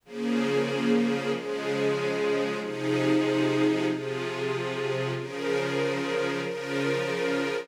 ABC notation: X:1
M:4/4
L:1/8
Q:1/4=94
K:Fm
V:1 name="String Ensemble 1"
[D,F,B,A]4 [D,F,A,A]4 | [C,F,EA]4 [C,F,FA]4 | [D,F,AB]4 [D,F,FB]4 |]